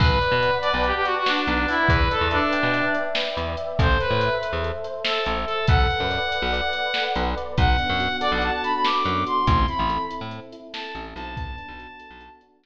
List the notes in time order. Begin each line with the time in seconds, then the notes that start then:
0.00 B1 B4, kick, crash
0.21 D5, closed hi-hat
0.32 B2
0.42 F#5, closed hi-hat
0.62 D5 A5, closed hi-hat
0.72 B1 B4
0.84 G4 F#5, closed hi-hat
0.95 G4
1.05 F#4 D5, closed hi-hat
1.17 F#4
1.26 D4 B4, snare
1.47 B1 D5, closed hi-hat
1.68 E4 F#5, open hi-hat
1.89 E2 B4, kick, closed hi-hat
2.11 A4 D5, closed hi-hat
2.21 E2
2.31 D4 E5, closed hi-hat
2.53 G5, closed hi-hat
2.63 B2
2.74 E5, closed hi-hat
2.94 D5, closed hi-hat
3.15 B4, snare
3.37 E2 D5, closed hi-hat
3.57 E5, closed hi-hat
3.79 A1 A4 C5, kick, closed hi-hat
4.00 B4 C5, closed hi-hat
4.10 A2
4.21 E5, closed hi-hat
4.42 C5, closed hi-hat
4.53 E2
4.63 A4, closed hi-hat
4.84 C5, closed hi-hat
5.05 A4 E5, snare
5.26 A1 C5, closed hi-hat
5.46 A4, closed hi-hat
5.67 B1 A4 F#5, kick, closed hi-hat
5.90 B4, closed hi-hat
6.00 F#2
6.10 D5, closed hi-hat
6.31 F#5, closed hi-hat
6.42 B1
6.53 D5, closed hi-hat
6.73 B4, closed hi-hat
6.94 A4, snare
7.15 B1 B4, closed hi-hat
7.37 D5, closed hi-hat
7.58 B1 B3 F#5, kick, closed hi-hat
7.78 D4, closed hi-hat
7.89 F#2
8.00 F#4, closed hi-hat
8.21 A4 D5, closed hi-hat
8.32 B1 F#5
8.42 F#4 A5, closed hi-hat
8.52 A5
8.63 D4 B5, closed hi-hat
8.73 B5
8.84 B3 D6, snare
9.05 F#2 D4, closed hi-hat
9.26 F#4 C6, closed hi-hat
9.47 A1 C4 C6, kick, closed hi-hat
9.68 E4 B5, closed hi-hat
9.79 A1
9.89 A4, closed hi-hat
10.11 E4, closed hi-hat
10.21 A2
10.31 C4, closed hi-hat
10.52 E4, closed hi-hat
10.73 A4 A5, snare
10.95 A1 E4, closed hi-hat
11.15 B1 C4 A5, closed hi-hat
11.36 B3 A5, kick, closed hi-hat
11.58 D4, closed hi-hat
11.68 B1
11.79 F#4, closed hi-hat
11.99 A4, closed hi-hat
12.11 B1
12.21 F#4, closed hi-hat
12.41 D4, closed hi-hat
12.63 B3, snare